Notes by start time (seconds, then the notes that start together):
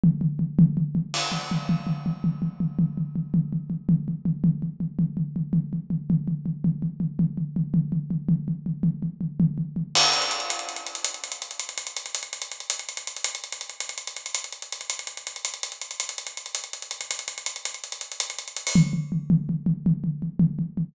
0.04 floor tom
0.21 floor tom
0.39 floor tom
0.59 floor tom
0.77 floor tom
0.95 floor tom
1.14 crash
1.32 floor tom
1.51 floor tom
1.69 floor tom
1.87 floor tom
2.06 floor tom
2.24 floor tom
2.42 floor tom
2.60 floor tom
2.79 floor tom
2.97 floor tom
3.16 floor tom
3.34 floor tom
3.53 floor tom
3.70 floor tom
3.89 floor tom
4.08 floor tom
4.25 floor tom
4.44 floor tom
4.62 floor tom
4.80 floor tom
4.99 floor tom
5.17 floor tom
5.36 floor tom
5.53 floor tom
5.73 floor tom
5.90 floor tom
6.10 floor tom
6.28 floor tom
6.46 floor tom
6.64 floor tom
6.82 floor tom
7.00 floor tom
7.19 floor tom
7.37 floor tom
7.56 floor tom
7.74 floor tom
7.92 floor tom
8.11 floor tom
8.29 floor tom
8.48 floor tom
8.66 floor tom
8.83 floor tom
9.03 floor tom
9.21 floor tom
9.40 floor tom
9.58 floor tom
9.76 floor tom
9.95 crash
10.03 closed hi-hat
10.13 closed hi-hat
10.22 closed hi-hat
10.31 closed hi-hat
10.40 closed hi-hat
10.50 closed hi-hat
10.59 closed hi-hat
10.69 closed hi-hat
10.76 closed hi-hat
10.86 closed hi-hat
10.95 closed hi-hat
11.04 closed hi-hat
11.14 closed hi-hat
11.24 closed hi-hat
11.32 closed hi-hat
11.42 closed hi-hat
11.51 closed hi-hat
11.59 closed hi-hat
11.69 closed hi-hat
11.78 closed hi-hat
11.87 closed hi-hat
11.96 closed hi-hat
12.06 closed hi-hat
12.15 closed hi-hat
12.23 closed hi-hat
12.33 closed hi-hat
12.42 closed hi-hat
12.52 closed hi-hat
12.60 closed hi-hat
12.70 closed hi-hat
12.79 closed hi-hat
12.89 closed hi-hat
12.97 closed hi-hat
13.07 closed hi-hat
13.16 closed hi-hat
13.24 closed hi-hat
13.35 closed hi-hat
13.44 closed hi-hat
13.52 closed hi-hat
13.61 closed hi-hat
13.69 closed hi-hat
13.80 closed hi-hat
13.89 closed hi-hat
13.98 closed hi-hat
14.07 closed hi-hat
14.17 closed hi-hat
14.26 closed hi-hat
14.35 closed hi-hat
14.44 closed hi-hat
14.52 closed hi-hat
14.62 closed hi-hat
14.72 closed hi-hat
14.81 closed hi-hat
14.90 closed hi-hat
14.99 closed hi-hat
15.07 closed hi-hat
15.17 closed hi-hat
15.27 closed hi-hat
15.36 closed hi-hat
15.45 closed hi-hat
15.54 closed hi-hat
15.63 closed hi-hat
15.72 closed hi-hat
15.81 closed hi-hat
15.91 closed hi-hat
16.00 closed hi-hat
16.09 closed hi-hat
16.18 closed hi-hat
16.27 closed hi-hat
16.37 closed hi-hat
16.46 closed hi-hat
16.55 closed hi-hat
16.64 closed hi-hat
16.73 closed hi-hat
16.82 closed hi-hat
16.91 closed hi-hat
17.01 closed hi-hat
17.11 closed hi-hat
17.19 closed hi-hat
17.28 closed hi-hat
17.38 closed hi-hat
17.46 closed hi-hat
17.56 closed hi-hat
17.65 closed hi-hat
17.74 closed hi-hat
17.84 closed hi-hat
17.92 closed hi-hat
18.01 closed hi-hat
18.12 closed hi-hat
18.20 closed hi-hat
18.30 closed hi-hat
18.39 closed hi-hat
18.48 closed hi-hat
18.56 closed hi-hat
18.67 open hi-hat
18.75 floor tom
18.93 floor tom
19.12 floor tom
19.30 floor tom
19.49 floor tom
19.66 floor tom
19.86 floor tom
20.04 floor tom
20.22 floor tom
20.40 floor tom
20.59 floor tom
20.77 floor tom